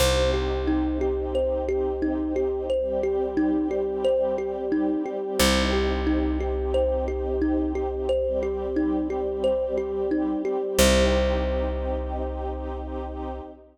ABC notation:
X:1
M:4/4
L:1/8
Q:1/4=89
K:Cdor
V:1 name="Kalimba"
c G E G c G E G | c G E G c G E G | c G E G c G E G | c G E G c G E G |
c8 |]
V:2 name="String Ensemble 1"
[CEG]8 | [G,CG]8 | [CEG]8 | [G,CG]8 |
[CEG]8 |]
V:3 name="Electric Bass (finger)" clef=bass
C,,8- | C,,8 | C,,8- | C,,8 |
C,,8 |]